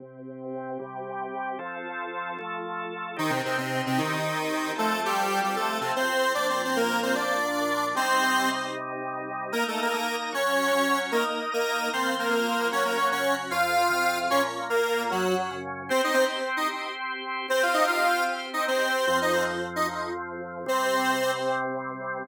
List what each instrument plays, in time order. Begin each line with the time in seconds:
0.00 drawbar organ C3 C4 G4
0.79 drawbar organ C3 G3 G4
1.59 drawbar organ F3 C4 A4
2.39 drawbar organ F3 A3 A4
3.17 lead 1 (square) D#3 D#4, drawbar organ C4 D#4 G4
3.30 lead 1 (square) C3 C4
3.45 lead 1 (square) C3 C4
3.58 lead 1 (square) C3 C4
3.86 lead 1 (square) C3 C4
3.98 lead 1 (square) D#3 D#4
4.76 drawbar organ F3 C4 A4, lead 1 (square) A3 A4
5.05 lead 1 (square) G3 G4
5.44 lead 1 (square) G3 G4
5.56 lead 1 (square) A3 A4
5.81 lead 1 (square) C3 C4
5.96 lead 1 (square) C4 C5
6.34 drawbar organ A#2 F3 D4, lead 1 (square) D4 D5
6.50 lead 1 (square) C4 C5
6.64 lead 1 (square) C4 C5
6.76 lead 1 (square) A#3 A#4
7.03 lead 1 (square) C4 C5
7.15 lead 1 (square) D4 D5
7.95 drawbar organ C3 G3 D#4, lead 1 (square) C4 C5
9.52 lead 1 (square) A#3 A#4, drawbar organ D#4 A#4 D#5
9.68 lead 1 (square) A3 A4
9.82 lead 1 (square) A#3 A#4
9.93 lead 1 (square) A#3 A#4, drawbar organ D#4 D#5 A#5
10.33 drawbar organ F#3 F#4 C#5, lead 1 (square) C#4 C#5
10.73 drawbar organ F#3 C#4 C#5
11.12 lead 1 (square) A#3 A#4, drawbar organ D#4 A#4 D#5
11.52 lead 1 (square) A#3 A#4, drawbar organ D#4 D#5 A#5
11.93 drawbar organ F3 F4 C5, lead 1 (square) C4 C5
12.19 lead 1 (square) A#3 A#4
12.30 drawbar organ F3 C4 C5, lead 1 (square) A#3 A#4
12.71 drawbar organ F#3 C#4 F#4, lead 1 (square) C#4 C#5
12.85 lead 1 (square) A#3 A#4
12.97 lead 1 (square) C#4 C#5
13.11 drawbar organ C#3 F#3 F#4, lead 1 (square) C#4 C#5
13.51 drawbar organ F2 F3 C4, lead 1 (square) F4 F5
13.90 drawbar organ F2 C3 C4
14.30 drawbar organ A#2 F3 A#3, lead 1 (square) C#4 C#5
14.70 drawbar organ A#2 A#3 F4, lead 1 (square) A#3 A#4
15.10 drawbar organ F#2 F#3 C#4, lead 1 (square) F#3 F#4
15.51 drawbar organ F#2 C#3 C#4
15.89 drawbar organ C4 G4 C5, lead 1 (square) C4 C5
16.04 lead 1 (square) D#4 D#5
16.14 lead 1 (square) C4 C5
16.57 lead 1 (square) D#4 D#5
17.48 drawbar organ C4 G4 C5, lead 1 (square) C4 C5
17.63 lead 1 (square) F4 F5
17.74 lead 1 (square) D#4 D#5
17.87 lead 1 (square) F4 F5
18.53 lead 1 (square) D#4 D#5
18.68 lead 1 (square) C4 C5
19.07 drawbar organ F2 F3 C4, lead 1 (square) C4 C5
19.22 lead 1 (square) D#4 D#5
19.32 lead 1 (square) C4 C5
19.76 lead 1 (square) D#4 D#5
20.66 drawbar organ C3 G3 C4, lead 1 (square) C4 C5